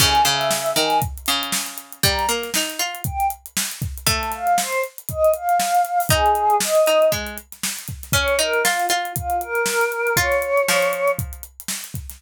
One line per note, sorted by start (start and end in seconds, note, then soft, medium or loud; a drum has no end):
0.00 0.21 C#3 loud
0.00 0.23 G#5 medium
0.00 kick loud
0.00 crash loud
0.15 closed hi-hat medium
0.25 0.73 C#3 medium
0.25 0.71 E5 medium
0.25 closed hi-hat medium
0.41 snare soft
0.41 closed hi-hat medium
0.51 snare loud
0.66 closed hi-hat medium
0.76 1.00 D#3 medium
0.76 0.98 G#5 medium
0.76 snare soft
0.76 closed hi-hat medium
0.90 snare soft
0.90 closed hi-hat medium
1.02 kick loud
1.02 closed hi-hat loud
1.17 closed hi-hat medium
1.26 1.99 C#3 medium
1.26 closed hi-hat medium
1.43 closed hi-hat medium
1.52 snare loud
1.66 snare soft
1.66 closed hi-hat medium
1.78 closed hi-hat medium
1.92 closed hi-hat medium
2.03 2.26 G3 loud
2.03 2.27 A#5 loud
2.03 kick loud
2.03 closed hi-hat loud
2.19 closed hi-hat medium
2.29 2.50 A#3 medium
2.29 snare soft
2.29 closed hi-hat medium
2.43 snare soft
2.43 closed hi-hat medium
2.54 2.80 D#4 medium
2.54 snare loud
2.70 closed hi-hat medium
2.79 3.01 F4 medium
2.79 closed hi-hat medium
2.95 closed hi-hat medium
3.04 3.26 G5 medium
3.04 kick loud
3.04 closed hi-hat loud
3.20 closed hi-hat medium
3.30 closed hi-hat medium
3.46 closed hi-hat medium
3.57 snare loud
3.70 snare soft
3.70 closed hi-hat medium
3.82 kick loud
3.82 closed hi-hat medium
3.98 closed hi-hat medium
4.07 4.75 A3 loud
4.07 4.29 A5 loud
4.07 kick loud
4.07 closed hi-hat loud
4.23 closed hi-hat medium
4.32 4.57 F5 medium
4.32 snare soft
4.32 closed hi-hat medium
4.47 closed hi-hat medium
4.57 4.81 C5 medium
4.57 snare loud
4.73 closed hi-hat medium
4.84 closed hi-hat medium
4.98 closed hi-hat medium
5.09 5.31 D#5 medium
5.09 kick medium
5.09 closed hi-hat loud
5.24 closed hi-hat medium
5.33 6.01 F5 medium
5.33 closed hi-hat medium
5.49 closed hi-hat medium
5.60 snare loud
5.75 closed hi-hat medium
5.85 closed hi-hat medium
6.00 open hi-hat medium
6.09 6.58 D#4 loud
6.09 6.55 G#4 loud
6.09 kick loud
6.09 closed hi-hat loud
6.26 closed hi-hat medium
6.35 closed hi-hat medium
6.50 closed hi-hat medium
6.60 7.11 D#5 medium
6.60 snare loud
6.75 snare soft
6.75 closed hi-hat medium
6.86 7.11 D#4 medium
6.86 closed hi-hat medium
7.02 closed hi-hat medium
7.12 7.37 G#3 medium
7.12 kick medium
7.12 closed hi-hat loud
7.27 closed hi-hat medium
7.38 closed hi-hat medium
7.52 snare soft
7.52 closed hi-hat medium
7.63 snare loud
7.76 snare soft
7.76 closed hi-hat medium
7.88 kick medium
7.88 closed hi-hat medium
8.03 snare soft
8.03 closed hi-hat medium
8.12 8.36 C#4 medium
8.12 8.38 C#5 loud
8.12 kick loud
8.12 closed hi-hat loud
8.28 closed hi-hat medium
8.39 8.64 D#4 medium
8.39 8.63 A#4 medium
8.39 closed hi-hat medium
8.53 closed hi-hat medium
8.64 8.85 F4 medium
8.64 8.86 F4 medium
8.64 snare loud
8.80 closed hi-hat medium
8.89 9.12 F4 medium
8.89 closed hi-hat medium
9.05 closed hi-hat medium
9.16 9.41 F4 medium
9.16 kick medium
9.16 closed hi-hat loud
9.30 closed hi-hat medium
9.41 10.14 A#4 medium
9.41 closed hi-hat medium
9.55 closed hi-hat medium
9.66 snare loud
9.81 closed hi-hat medium
9.92 closed hi-hat medium
10.07 closed hi-hat medium
10.17 10.62 F4 loud
10.17 11.10 C#5 loud
10.17 kick loud
10.17 closed hi-hat loud
10.31 snare soft
10.31 closed hi-hat medium
10.42 closed hi-hat medium
10.57 closed hi-hat medium
10.68 11.42 F3 medium
10.68 snare loud
10.82 closed hi-hat medium
10.93 closed hi-hat medium
11.08 closed hi-hat medium
11.19 kick loud
11.19 closed hi-hat loud
11.33 closed hi-hat medium
11.43 closed hi-hat medium
11.60 closed hi-hat medium
11.68 snare loud
11.84 closed hi-hat medium
11.94 kick medium
11.94 closed hi-hat medium
12.10 snare soft
12.10 closed hi-hat medium